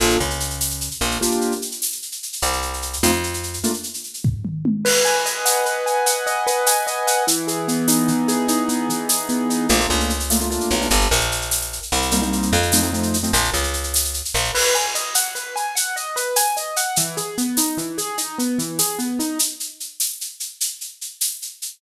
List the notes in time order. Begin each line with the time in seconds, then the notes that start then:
0.00 A#1 A#3 D4 F4 A4, shaker
0.10 shaker
0.20 C#2 C#3, shaker
0.30 shaker
0.40 shaker
0.50 shaker
0.61 tambourine, shaker
0.70 shaker
0.81 shaker
0.91 shaker
1.01 A#1 A#3, shaker
1.11 shaker
1.21 A#3 D4 F4 G4, shaker
1.31 shaker
1.41 shaker
1.52 shaker
1.62 shaker
1.71 shaker
1.82 tambourine, shaker
1.92 shaker
2.02 shaker
2.12 shaker
2.23 shaker
2.33 shaker
2.42 C2, shaker
2.53 shaker
2.62 shaker
2.73 shaker
2.82 shaker
2.93 shaker
3.03 F2 A3 C4 D#4 F4, tambourine, shaker
3.13 shaker
3.23 shaker
3.34 shaker
3.43 shaker
3.53 shaker
3.63 A3 A#3 D4 F4, shaker
3.73 shaker
3.83 shaker
3.94 shaker
4.04 shaker
4.14 shaker
4.24 kick, floor tom
4.45 mid tom
4.65 high tom
4.85 B4, crash
5.05 G#5, shaker
5.25 D#5, shaker
5.45 F#5, tambourine, shaker
5.66 B4, shaker
5.86 G#5, shaker
6.06 F#5, shaker
6.26 D#5, shaker
6.47 B4, shaker
6.66 G#5, tambourine, shaker
6.87 D#5, shaker
7.07 F#5, shaker
7.27 E3, shaker
7.47 G#4, shaker
7.68 B3, shaker
7.88 D#4, tambourine, shaker
8.08 E3, shaker
8.28 G#4, shaker
8.48 D#4, shaker
8.69 B3, shaker
8.89 E3, shaker
9.09 G#4, tambourine, shaker
9.29 B3, shaker
9.49 D#4, shaker
9.69 A#1 A3 A#3 D4 F4, shaker
9.80 A3 A#3 D4 F4, shaker
9.90 C#2, shaker
10.00 shaker
10.10 shaker
10.20 shaker
10.30 A3 A#3 D4 F4, tambourine, shaker
10.40 A3 A#3 D4 F4, shaker
10.50 A3 A#3 D4 F4, shaker
10.61 shaker
10.70 B1, shaker
10.81 A3 A#3 D4 F4, shaker
10.90 G1, shaker
11.01 shaker
11.11 A#1, shaker
11.20 shaker
11.31 shaker
11.41 shaker
11.51 tambourine, shaker
11.62 shaker
11.73 shaker
11.82 shaker
11.92 C2, shaker
12.02 shaker
12.11 G3 A#3 C4 D#4, shaker
12.22 G3 A#3 C4 D#4, shaker
12.32 shaker
12.42 shaker
12.53 F2, shaker
12.63 shaker
12.72 F3 A3 C4 D#4, tambourine, shaker
12.83 F3 A3 C4 D#4, shaker
12.93 F3 A3 C4 D#4, shaker
13.03 shaker
13.14 shaker
13.23 F3 A3 C4 D#4, shaker
13.33 A#1, shaker
13.44 shaker
13.54 C#2, shaker
13.63 shaker
13.73 shaker
13.83 shaker
13.94 tambourine, shaker
14.05 shaker
14.14 shaker
14.25 shaker
14.34 A#1, shaker
14.44 shaker
14.55 B4, crash
14.74 G#5, shaker
14.95 D#5, shaker
15.15 F#5, tambourine, shaker
15.35 B4, shaker
15.56 G#5, shaker
15.75 F#5, shaker
15.96 D#5, shaker
16.16 B4, shaker
16.36 G#5, tambourine, shaker
16.57 D#5, shaker
16.76 F#5, shaker
16.96 E3, shaker
17.17 G#4, shaker
17.38 B3, shaker
17.57 D#4, tambourine, shaker
17.77 E3, shaker
17.98 G#4, shaker
18.18 D#4, shaker
18.38 B3, shaker
18.58 E3, shaker
18.79 G#4, tambourine, shaker
18.99 B3, shaker
19.19 D#4, shaker
19.39 shaker
19.60 shaker
19.80 shaker
20.00 tambourine, shaker
20.21 shaker
20.40 shaker
20.61 shaker
20.81 shaker
21.01 shaker
21.21 tambourine, shaker
21.42 shaker
21.62 shaker